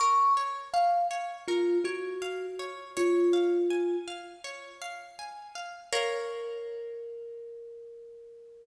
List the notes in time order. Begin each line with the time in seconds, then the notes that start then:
0.00 A#4 C#6
0.37 C#5
0.73 F5
1.11 C#5
1.48 F4 A#4
1.84 F#4 C#5
2.22 F5
2.59 C#5
2.97 F4 C#5
3.33 F5
3.70 G#5
4.08 F5
4.44 C#5
4.82 F5
5.19 G#5
5.55 F5
5.93 A#4 C#5 F5